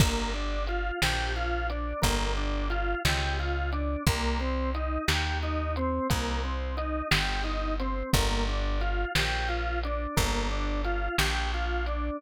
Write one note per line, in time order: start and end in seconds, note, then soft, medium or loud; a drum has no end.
0.00 0.91 G1 medium
0.00 0.31 A#3 loud
0.00 kick loud
0.00 crash loud
0.34 0.64 D4 medium
0.67 0.99 F4 medium
0.67 closed hi-hat medium
1.02 1.94 A#1 medium
1.02 1.32 G4 medium
1.02 snare loud
1.36 1.67 F4 medium
1.70 2.01 D4 medium
1.70 closed hi-hat medium
2.02 2.95 G1 medium
2.02 2.32 A#3 medium
2.02 kick medium
2.02 closed hi-hat loud
2.37 2.67 D4 medium
2.70 3.01 F4 medium
2.70 closed hi-hat medium
3.05 3.96 C#2 medium
3.05 3.37 G4 medium
3.05 snare loud
3.39 3.70 F4 medium
3.72 4.03 D4 medium
3.72 closed hi-hat medium
4.07 4.98 C2 medium
4.07 4.38 A#3 medium
4.07 kick loud
4.07 closed hi-hat loud
4.40 4.71 C4 medium
4.74 5.05 D#4 medium
4.74 closed hi-hat medium
5.08 6.00 D#2 medium
5.08 5.38 G4 medium
5.08 snare loud
5.43 5.73 D#4 medium
5.76 6.07 C4 medium
5.76 closed hi-hat medium
6.10 7.02 C2 medium
6.10 6.41 A#3 medium
6.10 kick medium
6.10 closed hi-hat loud
6.44 6.74 C4 medium
6.77 7.07 D#4 medium
6.77 closed hi-hat medium
7.11 8.03 G1 medium
7.11 7.41 G4 medium
7.11 snare loud
7.44 7.75 D#4 medium
7.80 8.10 C4 medium
7.80 closed hi-hat medium
8.13 9.05 G1 loud
8.13 8.45 A#3 loud
8.13 kick loud
8.13 closed hi-hat loud
8.48 8.79 D4 medium
8.81 9.11 F4 medium
8.81 closed hi-hat medium
9.15 10.07 A#1 medium
9.15 9.47 G4 medium
9.15 snare loud
9.48 9.79 F4 medium
9.83 10.15 D4 medium
9.83 closed hi-hat medium
10.17 11.09 G1 medium
10.17 10.47 A#3 medium
10.17 kick medium
10.17 closed hi-hat loud
10.51 10.81 D4 medium
10.84 11.15 F4 medium
10.84 closed hi-hat medium
11.18 12.10 A#1 medium
11.18 11.49 G4 medium
11.18 snare loud
11.54 11.85 F4 medium
11.86 12.18 D4 medium
11.86 closed hi-hat medium